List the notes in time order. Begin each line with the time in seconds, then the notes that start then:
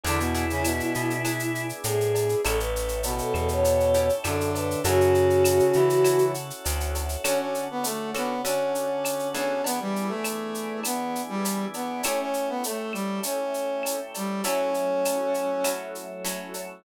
0.04 E2 D3 B3 D4 E4 G#4, cowbell, shaker
0.19 B2 B3, shaker
0.34 B3 D4 E4 G#4, shaker
0.50 C#3 C#4, shaker
0.64 B2 B3, cowbell, claves, shaker
0.80 shaker
0.95 B2, shaker
1.10 shaker
1.25 B3 D4 E4 G#4, cowbell, claves, shaker
1.39 shaker
1.55 shaker
1.69 shaker
1.84 A2 G#4, cowbell, shaker
2.00 shaker
2.15 cowbell, shaker
2.29 shaker
2.44 A1 C#4 E4 G4 A4, cowbell, claves, shaker
2.59 B4, shaker
2.76 shaker
2.88 shaker
3.03 B2 B3, cowbell, shaker
3.18 A4, shaker
3.34 E2 A4, claves, shaker
3.48 C#5, shaker
3.64 cowbell, shaker
3.80 shaker
3.94 C#4 E4 G4 A4, shaker
4.09 shaker
4.24 F#2 D3 C#4 D4 E4 G4 A4, cowbell, claves, shaker
4.41 shaker
4.54 B4, cowbell, shaker
4.71 shaker
4.84 F#2 C#3 C#4 E4 F#4 A4, cowbell, shaker
5.01 shaker
5.15 shaker
5.30 shaker
5.45 cowbell, claves, shaker
5.59 shaker
5.73 C#3 E3 E4, shaker
5.90 shaker
6.04 C#4 E4 F#4 A4, cowbell, claves, shaker
6.18 shaker
6.34 shaker
6.50 shaker
6.65 D2, cowbell, shaker
6.80 shaker
6.95 cowbell, shaker
7.09 shaker
7.24 D3 C#4 F#4 A4, cowbell, claves, shaker
7.40 C#4
7.54 shaker
7.71 B3
7.83 A3, cowbell, shaker
8.14 D3 B3 C#4 F#4 A4, claves, shaker
8.45 D3 C#4 F#4 A4, cowbell, shaker
8.75 shaker
9.04 cowbell, claves, shaker
9.19 shaker
9.34 E3 B3 C#4 D4 G#4, cowbell, shaker
9.64 E3 B3 D4 G#4, cowbell, shaker
9.80 G3
9.96 shaker
10.08 A3
10.24 cowbell, claves, shaker
10.54 shaker
10.83 B3, cowbell, claves, shaker
11.15 shaker
11.29 G3
11.45 cowbell, shaker
11.74 B3, cowbell, shaker
12.03 A3 C#4 E4 G4, cowbell, claves, shaker
12.21 C#4
12.34 shaker
12.49 B3
12.64 A3, cowbell, shaker
12.93 G3, claves, shaker
13.23 C#4, cowbell, shaker
13.54 shaker
13.83 cowbell, claves, shaker
14.14 G3, cowbell, shaker
14.44 F#3 A3 C#4 E4 A4, cowbell, shaker
14.74 shaker
15.05 cowbell, claves, shaker
15.34 shaker
15.64 F#3 C#4 E4 A4, cowbell, claves, shaker
15.95 shaker
16.25 F#3 C#4 E4 A4, cowbell, shaker
16.54 cowbell, shaker